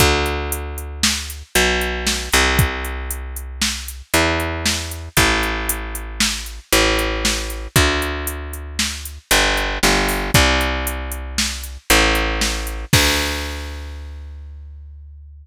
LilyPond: <<
  \new Staff \with { instrumentName = "Electric Bass (finger)" } { \clef bass \time 5/4 \key d \minor \tempo 4 = 116 d,2. b,,4. c,8~ | c,2. e,2 | a,,2. a,,2 | d,2. g,,4 g,,4 |
c,2. a,,2 | d,1~ d,4 | }
  \new DrumStaff \with { instrumentName = "Drums" } \drummode { \time 5/4 <hh bd>8 hh8 hh8 hh8 sn8 hh8 hh8 hh8 sn8 hh8 | <hh bd>8 hh8 hh8 hh8 sn8 hh8 hh8 hh8 sn8 hh8 | <hh bd>8 hh8 hh8 hh8 sn8 hh8 hh8 hh8 sn8 hh8 | <hh bd>8 hh8 hh8 hh8 sn8 hh8 hh8 hh8 sn8 hho8 |
<hh bd>8 hh8 hh8 hh8 sn8 hh8 hh8 hh8 sn8 hh8 | <cymc bd>4 r4 r4 r4 r4 | }
>>